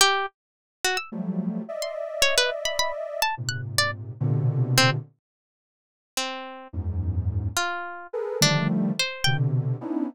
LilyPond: <<
  \new Staff \with { instrumentName = "Ocarina" } { \time 6/8 \tempo 4. = 71 r2 <f ges g a>4 | <d'' ees'' e''>2. | <aes, bes, c>4. <bes, b, c d>4. | r2. |
<e, ges, aes,>4. r4 <aes' a' bes' b'>8 | <d ees f g a>4 r8 <b, c d>4 <b des' d' ees' e'>8 | }
  \new Staff \with { instrumentName = "Orchestral Harp" } { \time 6/8 g'8 r4 ges'16 e'''16 r4 | r16 c'''16 r8 des''16 b'16 r16 b''16 b''16 r8 a''16 | r16 ges'''16 r16 d''16 r4. c'16 r16 | r2 c'4 |
r4. f'4 r8 | d'8 r8 c''8 g''16 r4 r16 | }
>>